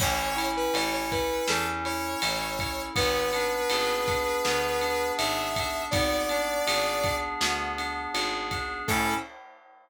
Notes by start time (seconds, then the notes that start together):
0.00 A1 C#4 C#5, kick, crash
0.36 E4, ride
0.57 B4
0.74 A1 A4 C#5, ride
0.93 C#5
1.11 E4 B4, kick, ride
1.47 E2 C#4 A4, snare
1.85 E4 C#5, ride
2.21 A1 A4, ride
2.59 E4, kick, ride
2.95 G#1 B3 B4, kick, ride
3.33 D4, ride
3.70 G#1 G#4, ride
4.08 D4, kick, ride
4.45 D2 B3, snare
4.81 D4, ride
5.18 G#1 G#4 E5, ride
5.56 D4, kick, ride
5.91 G#1 B3 D5, kick, ride
6.29 D4, ride
6.66 G#1 G#4, ride
7.04 D4, kick, ride
7.41 D2 B3, snare
7.77 D4, ride
8.14 G#1 G#4, ride
8.51 D4, kick, ride
8.88 A2 C#4 E4 A4, kick, crash